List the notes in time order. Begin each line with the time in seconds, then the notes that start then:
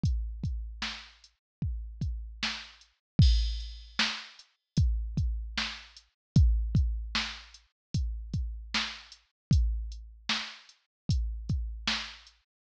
0.03 kick, closed hi-hat
0.44 kick, closed hi-hat
0.82 snare
1.24 closed hi-hat
1.62 kick
2.01 kick, closed hi-hat
2.43 snare
2.81 closed hi-hat
3.19 kick, crash
3.60 closed hi-hat
3.99 snare
4.39 closed hi-hat
4.77 kick, closed hi-hat
5.17 kick, closed hi-hat
5.58 snare
5.97 closed hi-hat
6.36 kick, closed hi-hat
6.75 kick, closed hi-hat
7.15 snare
7.54 closed hi-hat
7.94 kick, closed hi-hat
8.34 kick, closed hi-hat
8.74 snare
9.12 closed hi-hat
9.51 kick, closed hi-hat
9.92 closed hi-hat
10.29 snare
10.69 closed hi-hat
11.09 kick, closed hi-hat
11.49 kick, closed hi-hat
11.88 snare
12.27 closed hi-hat